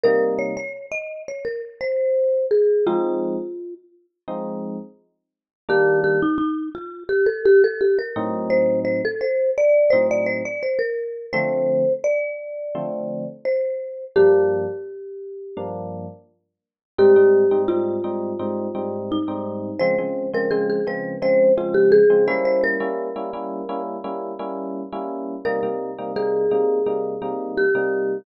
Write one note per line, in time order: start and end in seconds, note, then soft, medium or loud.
0.04 0.54 C3 loud
0.04 0.54 G3 loud
0.04 0.54 A#3 loud
0.04 0.54 D#4 loud
0.04 0.35 A#4 medium
0.39 0.55 C#5 medium
0.57 0.86 C#5 medium
0.92 1.23 D#5 medium
1.28 1.45 C#5 medium
1.45 1.62 A#4 medium
1.81 2.46 C5 medium
2.51 2.85 G#4 medium
2.86 3.36 F3 loud
2.86 3.36 G#3 loud
2.86 3.36 C4 loud
2.86 3.36 D#4 loud
2.86 3.74 F4 medium
4.28 4.77 F3 medium
4.28 4.77 G#3 medium
4.28 4.77 C4 medium
4.28 4.77 D#4 loud
5.69 6.18 D#3 loud
5.69 6.18 G3 loud
5.69 6.18 A#3 loud
5.69 6.18 D4 loud
5.69 6.00 G4 medium
6.04 6.21 G4 medium
6.22 6.37 D#4 medium
6.38 6.69 D#4 medium
6.75 7.04 F4 medium
7.09 7.26 G4 medium
7.26 7.43 A4 medium
7.45 7.62 G4 medium
7.64 7.81 A4 medium
7.81 7.98 G4 medium
7.99 8.48 A#4 medium
8.16 9.01 A2 loud
8.16 9.01 F#3 loud
8.16 9.01 C4 loud
8.16 9.01 D#4 loud
8.50 8.80 C5 medium
8.85 9.01 C5 medium
9.05 9.21 A4 medium
9.21 9.50 C5 medium
9.58 9.92 D5 medium
9.90 10.42 A2 loud
9.90 10.42 F#3 medium
9.90 10.42 C4 loud
9.90 10.42 D#4 medium
9.90 10.07 C5 medium
10.11 10.28 D5 medium
10.26 10.43 C5 medium
10.45 10.62 D5 medium
10.63 10.79 C5 medium
10.79 11.26 A#4 medium
11.33 11.83 D3 loud
11.33 11.83 F3 loud
11.33 11.83 A3 loud
11.33 11.83 C4 loud
11.33 11.93 C5 medium
12.04 13.28 D5 medium
12.75 13.24 D3 medium
12.75 13.24 F3 loud
12.75 13.24 A3 medium
12.75 13.24 C4 loud
13.45 14.05 C5 medium
14.16 14.65 G2 loud
14.16 14.65 F3 loud
14.16 14.65 A#3 loud
14.16 14.65 D4 loud
14.16 15.65 G4 medium
15.57 16.06 G2 medium
15.57 16.06 F3 medium
15.57 16.06 A#3 loud
15.57 16.06 D4 medium
16.98 17.12 G#2 loud
16.98 17.12 G3 loud
16.98 17.12 C4 loud
16.98 17.12 D#4 loud
16.98 17.62 G4 medium
17.16 17.44 G#2 medium
17.16 17.44 G3 loud
17.16 17.44 C4 medium
17.16 17.44 D#4 loud
17.51 17.65 G#2 medium
17.51 17.65 G3 loud
17.51 17.65 C4 medium
17.51 17.65 D#4 medium
17.68 17.97 G#2 medium
17.68 17.97 G3 medium
17.68 17.97 C4 medium
17.68 17.97 D#4 medium
17.68 18.98 F4 medium
18.04 18.32 G#2 medium
18.04 18.32 G3 medium
18.04 18.32 C4 medium
18.04 18.32 D#4 medium
18.39 18.68 G#2 loud
18.39 18.68 G3 medium
18.39 18.68 C4 loud
18.39 18.68 D#4 medium
18.75 19.17 G#2 medium
18.75 19.17 G3 loud
18.75 19.17 C4 medium
18.75 19.17 D#4 medium
19.12 19.81 D#4 medium
19.28 19.70 G#2 medium
19.28 19.70 G3 medium
19.28 19.70 C4 medium
19.28 19.70 D#4 medium
19.79 19.95 C#3 loud
19.79 19.95 F3 loud
19.79 19.95 G#3 loud
19.79 19.95 C4 loud
19.79 20.30 C5 medium
19.98 20.27 C#3 medium
19.98 20.27 F3 medium
19.98 20.27 G#3 medium
19.98 20.27 C4 medium
20.34 20.47 C#3 loud
20.34 20.47 F3 medium
20.34 20.47 G#3 medium
20.34 20.47 C4 loud
20.34 20.51 A#4 medium
20.51 20.79 C#3 medium
20.51 20.79 F3 medium
20.51 20.79 G#3 loud
20.51 20.79 C4 loud
20.51 20.67 G#4 medium
20.70 20.86 G#4 medium
20.87 21.15 C#3 medium
20.87 21.15 F3 medium
20.87 21.15 G#3 medium
20.87 21.15 C4 medium
20.87 21.17 B4 medium
21.22 21.50 C#3 medium
21.22 21.50 F3 medium
21.22 21.50 G#3 medium
21.22 21.50 C4 medium
21.22 21.53 C5 medium
21.57 22.00 C#3 medium
21.57 22.00 F3 medium
21.57 22.00 G#3 medium
21.57 22.00 C4 medium
21.57 21.75 F4 medium
21.74 21.91 G4 medium
21.92 22.25 G#4 medium
22.10 22.27 C#3 medium
22.10 22.27 F3 medium
22.10 22.27 G#3 medium
22.10 22.27 C4 medium
22.28 22.77 G3 loud
22.28 22.77 A#3 loud
22.28 22.77 C#4 loud
22.28 22.77 E4 loud
22.28 22.44 C5 medium
22.45 22.62 C5 medium
22.64 23.82 A#4 medium
22.80 23.09 G3 medium
22.80 23.09 A#3 medium
22.80 23.09 C#4 loud
22.80 23.09 E4 medium
23.16 23.30 G3 medium
23.16 23.30 A#3 medium
23.16 23.30 C#4 medium
23.16 23.30 E4 medium
23.33 23.62 G3 loud
23.33 23.62 A#3 medium
23.33 23.62 C#4 medium
23.33 23.62 E4 medium
23.69 23.97 G3 medium
23.69 23.97 A#3 loud
23.69 23.97 C#4 loud
23.69 23.97 E4 loud
24.04 24.32 G3 medium
24.04 24.32 A#3 medium
24.04 24.32 C#4 medium
24.04 24.32 E4 loud
24.39 24.82 G3 loud
24.39 24.82 A#3 medium
24.39 24.82 C#4 loud
24.39 24.82 E4 medium
24.92 25.35 G3 medium
24.92 25.35 A#3 medium
24.92 25.35 C#4 loud
24.92 25.35 E4 medium
25.45 25.59 C3 loud
25.45 25.59 G3 loud
25.45 25.59 A#3 loud
25.45 25.59 D#4 loud
25.45 26.11 A#4 medium
25.63 25.91 C3 medium
25.63 25.91 G3 medium
25.63 25.91 A#3 medium
25.63 25.91 D#4 medium
25.98 26.12 C3 loud
25.98 26.12 G3 loud
25.98 26.12 A#3 medium
25.98 26.12 D#4 medium
26.16 26.44 C3 medium
26.16 26.44 G3 loud
26.16 26.44 A#3 medium
26.16 26.44 D#4 medium
26.16 27.54 G#4 medium
26.51 26.80 C3 loud
26.51 26.80 G3 medium
26.51 26.80 A#3 loud
26.51 26.80 D#4 medium
26.86 27.15 C3 medium
26.86 27.15 G3 medium
26.86 27.15 A#3 loud
26.86 27.15 D#4 medium
27.22 27.64 C3 loud
27.22 27.64 G3 medium
27.22 27.64 A#3 loud
27.22 27.64 D#4 loud
27.57 28.18 G4 medium
27.75 28.17 C3 loud
27.75 28.17 G3 loud
27.75 28.17 A#3 medium
27.75 28.17 D#4 medium